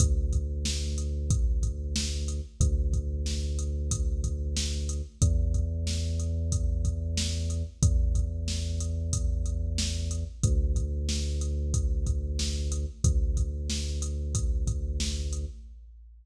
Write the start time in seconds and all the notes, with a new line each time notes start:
0.00 D2, kick, closed hi-hat
0.33 kick, closed hi-hat
0.65 snare
0.98 closed hi-hat
1.30 kick, closed hi-hat
1.63 kick, closed hi-hat
1.96 snare
2.28 closed hi-hat
2.60 D2, kick, closed hi-hat
2.93 kick, closed hi-hat
3.26 snare
3.59 closed hi-hat
3.91 kick, closed hi-hat
4.24 kick, closed hi-hat
4.57 snare
4.89 closed hi-hat
5.22 E2, kick, closed hi-hat
5.54 kick, closed hi-hat
5.87 snare
6.20 closed hi-hat
6.52 kick, closed hi-hat
6.85 kick, closed hi-hat
7.17 snare
7.50 closed hi-hat
7.83 E2, kick, closed hi-hat
8.15 kick, closed hi-hat
8.48 snare
8.80 closed hi-hat
9.13 kick, closed hi-hat
9.46 closed hi-hat
9.78 snare
10.11 closed hi-hat
10.43 D2, kick, closed hi-hat
10.76 kick, closed hi-hat
11.09 snare
11.41 closed hi-hat
11.74 kick, closed hi-hat
12.07 kick, closed hi-hat
12.39 snare
12.72 closed hi-hat
13.04 D2, kick, closed hi-hat
13.37 kick, closed hi-hat
13.70 snare
14.02 closed hi-hat
14.35 kick, closed hi-hat
14.67 kick, closed hi-hat
15.00 snare
15.33 closed hi-hat